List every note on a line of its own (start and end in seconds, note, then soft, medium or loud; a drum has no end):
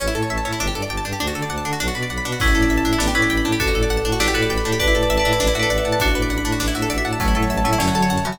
0.00 0.08 A1 medium
0.00 0.07 C#4 medium
0.00 0.29 C#5 loud
0.07 0.14 E4 medium
0.15 0.23 A2 medium
0.15 0.22 A4 medium
0.15 0.58 A5 medium
0.23 0.29 C#5 medium
0.30 0.38 A1 medium
0.30 0.58 C#5 medium
0.30 0.37 E5 medium
0.38 0.44 A5 medium
0.45 0.53 A2 medium
0.45 0.52 C#4 medium
0.45 0.59 E5 medium
0.53 0.59 E4 medium
0.60 0.68 G1 medium
0.60 0.67 D4 loud
0.60 0.90 D5 loud
0.67 0.74 G4 medium
0.75 0.83 G2 medium
0.75 0.82 A4 medium
0.75 1.18 A5 medium
0.82 0.89 D5 medium
0.90 0.98 G1 medium
0.90 1.19 D5 medium
0.90 0.97 G5 medium
0.97 1.04 A5 medium
1.05 1.13 G2 medium
1.05 1.12 D4 medium
1.05 1.19 G5 medium
1.13 1.19 G4 medium
1.20 1.29 D2 medium
1.20 1.27 D4 medium
1.20 1.50 D5 loud
1.27 1.34 F#4 medium
1.35 1.43 D3 medium
1.35 1.42 A4 medium
1.35 1.78 A5 medium
1.42 1.49 D5 medium
1.50 1.58 D2 medium
1.50 1.79 D5 medium
1.50 1.57 F#5 medium
1.58 1.64 A5 medium
1.65 1.73 D3 medium
1.65 1.72 D4 medium
1.65 1.79 F#5 medium
1.73 1.79 F#4 medium
1.80 1.88 B1 medium
1.80 1.87 D4 medium
1.80 2.10 D5 medium
1.88 1.94 F#4 medium
1.95 2.04 B2 medium
1.95 2.02 B4 medium
1.95 2.38 B5 medium
2.03 2.09 D5 medium
2.10 2.19 B1 medium
2.10 2.39 D5 medium
2.10 2.17 F#5 medium
2.18 2.24 B5 medium
2.25 2.34 B2 medium
2.25 2.32 D4 medium
2.25 2.39 F#5 medium
2.32 2.39 F#4 medium
2.39 2.48 A1 medium
2.39 2.96 C#4 medium
2.39 2.47 D4 loud
2.39 2.96 E4 medium
2.39 2.70 D5 loud
2.39 kick loud
2.39 crash loud
2.47 2.54 E4 medium
2.55 2.64 A2 medium
2.55 2.62 A4 medium
2.55 2.98 A5 medium
2.62 2.69 D5 medium
2.70 2.78 A1 medium
2.70 2.99 D5 medium
2.70 2.77 E5 medium
2.70 closed hi-hat medium
2.78 2.84 A5 medium
2.85 2.93 A2 medium
2.85 2.92 D4 medium
2.85 2.99 E5 medium
2.93 2.99 E4 medium
2.98 3.08 A1 loud
2.98 3.12 B3 medium
2.98 3.12 D4 medium
2.98 3.07 D4 medium
2.98 3.29 D5 loud
2.98 snare loud
3.08 3.14 G4 medium
3.15 3.24 A2 medium
3.15 3.56 C#4 medium
3.15 3.56 E4 medium
3.15 3.22 B4 medium
3.15 3.58 B5 medium
3.22 3.29 D5 medium
3.30 3.39 A1 medium
3.30 3.58 D5 medium
3.30 3.37 G5 medium
3.30 closed hi-hat medium
3.37 3.44 B5 medium
3.45 3.53 A2 medium
3.45 3.52 D4 medium
3.45 3.59 G5 medium
3.52 3.59 G4 medium
3.60 3.68 A1 medium
3.60 3.67 D4 loud
3.60 4.11 F#4 medium
3.60 4.11 A4 medium
3.60 3.90 D5 loud
3.60 kick loud
3.60 closed hi-hat loud
3.67 3.74 F#4 medium
3.74 3.83 A2 medium
3.74 3.82 A4 medium
3.74 4.18 A5 medium
3.83 3.89 D5 medium
3.90 3.99 A1 medium
3.90 4.19 D5 medium
3.90 3.97 F#5 medium
3.90 closed hi-hat medium
3.97 4.04 A5 medium
4.05 4.13 A2 medium
4.05 4.12 D4 medium
4.05 4.19 F#5 medium
4.12 4.19 F#4 medium
4.20 4.28 A1 medium
4.20 4.27 D4 loud
4.20 4.33 E4 medium
4.20 4.33 G4 medium
4.20 4.49 D5 loud
4.20 snare loud
4.28 4.34 G4 medium
4.34 4.44 A2 medium
4.34 4.78 F#4 medium
4.34 4.78 A4 medium
4.34 4.42 B4 medium
4.34 4.78 B5 loud
4.42 4.49 D5 medium
4.50 4.58 A1 medium
4.50 4.78 D5 medium
4.50 4.57 G5 medium
4.50 closed hi-hat medium
4.58 4.64 B5 medium
4.65 4.73 A2 medium
4.65 4.72 D4 medium
4.65 4.79 G5 medium
4.72 4.79 G4 medium
4.79 4.88 A1 loud
4.79 4.87 D4 loud
4.79 5.18 B4 medium
4.79 5.18 D5 medium
4.79 5.09 D5 loud
4.79 kick loud
4.79 closed hi-hat loud
4.88 4.94 E4 medium
4.95 5.03 A2 medium
4.95 5.02 A4 medium
4.95 5.38 A5 loud
5.03 5.09 D5 medium
5.10 5.18 A1 medium
5.10 5.38 D5 loud
5.10 5.17 E5 loud
5.10 closed hi-hat medium
5.17 5.53 B4 medium
5.17 5.53 D5 medium
5.17 5.24 A5 medium
5.25 5.33 A2 medium
5.25 5.32 D4 medium
5.25 5.39 E5 loud
5.33 5.39 E4 medium
5.40 5.48 A1 loud
5.40 5.47 D4 loud
5.40 5.97 D5 loud
5.40 snare loud
5.47 5.54 E4 medium
5.55 5.63 A2 medium
5.55 5.62 F#4 medium
5.55 5.98 E5 medium
5.59 5.69 A4 medium
5.59 5.98 B4 medium
5.59 5.98 D5 medium
5.70 5.78 A1 medium
5.70 5.77 D5 medium
5.70 5.99 F#5 medium
5.70 closed hi-hat medium
5.78 5.84 E5 medium
5.85 5.93 A2 medium
5.85 5.92 F#5 medium
5.85 5.99 A5 medium
5.92 5.99 A5 medium
6.00 6.09 A1 medium
6.00 6.07 D4 loud
6.00 6.96 D4 medium
6.00 6.96 F#4 loud
6.00 6.29 D5 loud
6.00 kick loud
6.00 closed hi-hat loud
6.08 6.14 F#4 medium
6.15 6.23 A2 medium
6.15 6.22 B4 medium
6.15 6.58 B5 medium
6.22 6.29 D5 medium
6.30 6.38 A1 medium
6.30 6.58 D5 loud
6.30 6.37 F#5 medium
6.30 closed hi-hat medium
6.38 6.44 B5 medium
6.45 6.53 A2 medium
6.45 6.52 D4 medium
6.45 6.59 F#5 medium
6.52 6.59 F#4 medium
6.60 6.68 A1 medium
6.60 6.67 D4 loud
6.60 7.17 D5 loud
6.60 snare loud
6.68 6.74 E4 medium
6.75 6.83 A2 medium
6.75 6.82 F#4 medium
6.75 7.18 E5 medium
6.82 6.89 A4 medium
6.90 6.98 A1 medium
6.90 6.97 D5 loud
6.90 7.19 F#5 medium
6.90 closed hi-hat medium
6.98 7.04 E5 medium
7.05 7.13 A2 medium
7.05 7.12 F#5 medium
7.05 7.19 A5 loud
7.13 7.19 A5 medium
7.20 7.29 A1 medium
7.20 7.34 F#3 medium
7.20 7.34 A3 medium
7.20 7.27 C#4 loud
7.20 7.49 C#5 loud
7.20 kick loud
7.20 closed hi-hat loud
7.28 7.34 E4 medium
7.35 7.44 A2 medium
7.35 7.64 F#3 medium
7.35 7.64 A3 medium
7.35 7.42 A4 medium
7.35 7.78 A5 medium
7.43 7.49 C#5 medium
7.50 7.59 A1 medium
7.50 7.78 C#5 medium
7.50 7.57 E5 medium
7.50 closed hi-hat medium
7.58 7.64 A5 medium
7.64 7.73 A2 medium
7.64 7.77 F#3 medium
7.64 7.77 A3 medium
7.64 7.72 C#4 medium
7.64 7.79 E5 medium
7.73 7.79 E4 medium
7.78 7.88 F#2 medium
7.78 8.19 D3 medium
7.78 8.19 F#3 medium
7.78 7.87 C#4 loud
7.78 8.10 C#5 loud
7.78 snare loud
7.88 7.94 F#4 medium
7.95 8.03 F#3 medium
7.95 8.02 A4 medium
7.95 8.38 A5 medium
8.02 8.09 C#5 medium
8.10 8.18 F#2 medium
8.10 8.38 C#5 medium
8.10 8.17 F#5 medium
8.10 closed hi-hat medium
8.18 8.24 A5 medium
8.24 8.39 C#3 medium
8.24 8.39 E3 medium
8.24 8.33 F#3 medium
8.24 8.32 C#4 medium
8.24 8.39 F#5 medium
8.32 8.39 F#4 medium